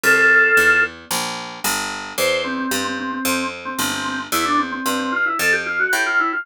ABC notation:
X:1
M:4/4
L:1/16
Q:1/4=112
K:F
V:1 name="Drawbar Organ"
[FA]6 z10 | c2 C C C C C C3 z C C C C z | E D C C C C F E A G F ^F G =F E F |]
V:2 name="Harpsichord" clef=bass
C,,4 E,,4 B,,,4 G,,,4 | E,,4 G,,4 F,,4 G,,,4 | E,,4 G,,4 F,,4 A,,4 |]